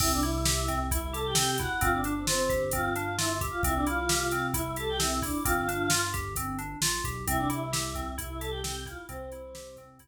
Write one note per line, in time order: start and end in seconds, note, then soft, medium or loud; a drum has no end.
0.00 1.67 C2 loud
0.00 0.21 C4 medium
0.00 0.12 E4 medium
0.00 0.12 E5 loud
0.00 kick loud
0.00 crash loud
0.13 0.24 D4 medium
0.13 0.24 D5 medium
0.22 0.79 E4 medium
0.22 0.43 E4 medium
0.22 0.79 E5 medium
0.22 closed hi-hat medium
0.45 0.66 G4 medium
0.45 snare loud
0.68 0.89 C4 medium
0.68 kick medium
0.68 closed hi-hat medium
0.91 1.01 E4 medium
0.91 1.12 E4 medium
0.91 1.01 E5 medium
0.91 kick medium
0.91 closed hi-hat medium
1.02 1.12 E4 medium
1.02 1.12 E5 medium
1.12 1.34 G4 medium
1.12 1.23 A4 medium
1.12 1.23 A5 medium
1.12 closed hi-hat medium
1.25 1.35 G4 medium
1.25 1.35 G5 medium
1.35 1.56 C4 medium
1.35 1.56 G4 medium
1.35 1.56 G5 medium
1.35 snare loud
1.58 1.80 E4 medium
1.58 1.81 F#4 medium
1.58 1.81 F#5 medium
1.58 kick medium
1.58 closed hi-hat medium
1.81 3.49 G1 loud
1.81 2.02 C4 loud
1.81 1.92 F4 medium
1.81 1.92 F5 loud
1.81 kick medium
1.81 closed hi-hat medium
1.93 2.14 D4 medium
1.93 2.14 D5 medium
2.04 2.26 D4 medium
2.04 closed hi-hat medium
2.17 2.26 C4 medium
2.17 2.26 C5 medium
2.27 2.64 C4 medium
2.27 2.48 F4 medium
2.27 2.64 C5 medium
2.27 snare medium
2.49 2.70 G4 medium
2.49 kick medium
2.49 closed hi-hat medium
2.71 2.93 C4 medium
2.71 3.13 F4 medium
2.71 3.13 F5 medium
2.71 kick medium
2.71 closed hi-hat medium
2.96 3.16 D4 medium
2.96 closed hi-hat medium
3.18 3.37 E4 medium
3.18 3.39 F4 medium
3.18 3.37 E5 medium
3.18 snare medium
3.41 3.62 G4 medium
3.41 kick medium
3.41 closed hi-hat medium
3.51 3.61 F4 medium
3.51 3.61 F5 medium
3.63 5.30 C2 loud
3.63 3.85 C4 medium
3.63 3.75 E4 medium
3.63 3.75 E5 medium
3.63 kick medium
3.63 closed hi-hat medium
3.75 3.86 D4 medium
3.75 3.86 D5 medium
3.87 4.07 E4 medium
3.87 4.43 F4 medium
3.87 4.43 F5 medium
3.87 closed hi-hat medium
4.09 4.30 G4 medium
4.09 snare loud
4.31 4.52 C4 medium
4.31 closed hi-hat medium
4.54 4.74 E4 medium
4.54 4.64 E4 medium
4.54 4.64 E5 medium
4.54 kick medium
4.54 closed hi-hat medium
4.65 4.76 E4 medium
4.65 4.76 E5 medium
4.76 4.97 G4 medium
4.76 4.89 A4 medium
4.76 4.89 A5 medium
4.76 closed hi-hat medium
4.89 5.00 G4 medium
4.89 5.00 G5 medium
4.99 5.20 C4 medium
4.99 5.22 E4 medium
4.99 5.22 E5 medium
4.99 snare medium
5.22 5.44 D4 medium
5.22 5.43 E4 medium
5.22 5.44 D5 medium
5.22 kick medium
5.22 open hi-hat medium
5.44 6.75 G1 loud
5.44 5.66 C4 medium
5.44 6.00 F4 medium
5.44 6.00 F5 medium
5.44 kick medium
5.44 closed hi-hat loud
5.68 5.89 D4 medium
5.68 closed hi-hat medium
5.90 6.11 F4 medium
5.90 snare loud
6.14 6.34 G4 medium
6.14 kick medium
6.14 closed hi-hat medium
6.36 6.57 C4 medium
6.36 kick medium
6.36 closed hi-hat medium
6.59 6.79 D4 medium
6.59 closed hi-hat medium
6.81 7.01 A#1 medium
6.81 7.03 F4 medium
6.81 snare loud
7.04 7.25 B1 medium
7.04 7.25 G4 medium
7.04 kick medium
7.04 closed hi-hat medium
7.27 8.94 C2 loud
7.27 7.48 C4 medium
7.27 7.40 E4 medium
7.27 7.40 E5 loud
7.27 kick medium
7.27 closed hi-hat loud
7.38 7.49 D4 medium
7.38 7.49 D5 medium
7.50 7.70 E4 medium
7.50 8.12 E4 medium
7.50 8.12 E5 medium
7.50 closed hi-hat medium
7.73 7.93 G4 medium
7.73 snare medium
7.95 8.16 C4 medium
7.95 kick medium
7.95 closed hi-hat medium
8.18 8.38 E4 medium
8.18 8.29 E4 medium
8.18 8.29 E5 medium
8.18 kick medium
8.18 closed hi-hat medium
8.30 8.40 E4 medium
8.30 8.40 E5 medium
8.39 8.62 G4 medium
8.39 8.50 A4 medium
8.39 8.50 A5 loud
8.39 closed hi-hat medium
8.50 8.61 G4 medium
8.50 8.61 G5 medium
8.64 8.84 C4 medium
8.64 8.85 G4 medium
8.64 8.85 G5 medium
8.64 snare loud
8.86 9.07 E4 medium
8.86 9.06 F4 medium
8.86 9.06 F5 medium
8.86 kick medium
8.86 closed hi-hat medium
9.09 10.08 C2 loud
9.09 9.75 C4 medium
9.09 9.29 C4 medium
9.09 9.75 C5 loud
9.09 kick medium
9.09 closed hi-hat medium
9.32 9.53 E4 medium
9.32 closed hi-hat medium
9.55 9.75 G4 medium
9.55 snare medium
9.77 9.98 C4 medium
9.77 kick medium
9.77 closed hi-hat medium
9.99 10.08 E4 medium
9.99 kick medium
9.99 closed hi-hat medium